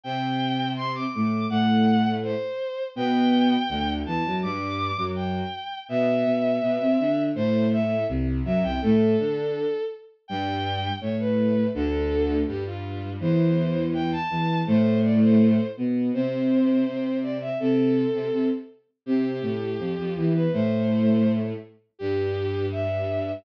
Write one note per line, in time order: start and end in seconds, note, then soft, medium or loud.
0.04 1.06 C3 medium
0.04 1.06 C4 medium
0.04 0.69 G5 medium
0.77 0.92 C6 medium
0.95 1.12 D6 medium
1.13 1.45 A2 medium
1.13 1.45 A3 medium
1.13 1.46 D6 medium
1.50 2.33 A2 medium
1.50 2.33 A3 medium
1.50 2.11 F#5 loud
2.23 2.83 C5 medium
2.96 3.55 B2 medium
2.96 3.55 B3 medium
2.96 3.91 G5 loud
3.69 4.03 D2 medium
3.69 4.03 D3 medium
4.06 4.22 E2 medium
4.06 4.22 E3 medium
4.06 4.36 A5 medium
4.26 4.43 F#2 medium
4.26 4.43 F#3 medium
4.43 4.90 G2 medium
4.43 4.90 G3 medium
4.43 5.02 D6 medium
4.97 5.41 F#2 medium
4.97 5.41 F#3 medium
5.16 5.78 G5 medium
5.89 6.24 B2 medium
5.89 6.24 B3 medium
5.89 7.21 E5 loud
6.25 6.59 B2 medium
6.25 6.59 B3 medium
6.62 6.78 B2 medium
6.62 6.78 B3 medium
6.80 6.98 C3 medium
6.80 6.98 C4 medium
7.00 7.30 D3 medium
7.00 7.30 D4 medium
7.35 8.04 A2 medium
7.35 8.04 A3 medium
7.35 7.66 C5 loud
7.72 8.04 E5 medium
8.08 8.41 C2 medium
8.08 8.41 C3 medium
8.44 8.62 F#2 medium
8.44 8.62 F#3 medium
8.44 8.63 E5 medium
8.63 8.79 C2 medium
8.63 8.79 C3 medium
8.63 8.80 G5 medium
8.81 9.14 A2 medium
8.81 9.14 A3 medium
8.81 9.82 A4 medium
9.19 9.64 D3 medium
9.19 9.64 D4 medium
10.28 10.89 G2 medium
10.28 10.89 G3 medium
10.28 10.92 G5 medium
11.01 11.67 A2 medium
11.01 11.67 A3 medium
11.01 11.16 C#5 medium
11.19 11.67 B4 medium
11.74 12.42 D2 medium
11.74 12.42 D3 medium
11.74 12.36 A4 medium
12.47 13.17 G2 medium
12.47 13.17 G3 medium
12.47 12.64 G4 medium
12.66 13.10 F4 medium
13.20 14.13 E2 medium
13.20 14.13 E3 medium
13.20 13.84 C5 medium
13.94 14.11 G5 medium
14.12 14.59 A5 medium
14.30 14.62 E2 medium
14.30 14.62 E3 medium
14.67 15.59 A2 medium
14.67 15.59 A3 medium
14.67 14.99 C5 medium
15.04 15.20 D5 medium
15.22 15.67 C5 medium
15.77 16.10 B2 medium
15.77 16.10 B3 medium
16.13 16.84 C3 medium
16.13 16.84 C4 medium
16.13 17.17 C5 medium
16.86 17.49 C3 medium
16.86 17.49 C4 medium
17.23 17.38 D5 medium
17.41 17.58 E5 medium
17.60 18.05 C3 medium
17.60 18.05 C4 medium
17.60 18.46 A4 medium
18.13 18.29 C3 medium
18.13 18.29 C4 medium
18.33 18.49 C3 medium
18.33 18.49 C4 medium
19.06 19.39 C3 medium
19.06 19.39 C4 medium
19.06 20.13 G4 medium
19.41 19.76 A2 medium
19.41 19.76 A3 medium
19.79 19.93 F2 medium
19.79 19.93 F3 medium
19.98 20.14 F2 medium
19.98 20.14 F3 medium
20.16 20.46 E2 medium
20.16 20.46 E3 medium
20.16 20.32 G4 medium
20.34 20.52 B4 medium
20.52 21.52 A2 medium
20.52 21.52 A3 medium
20.52 21.32 C5 medium
21.99 23.32 G2 medium
21.99 23.32 G3 medium
21.99 22.66 G4 loud
22.72 23.32 E5 medium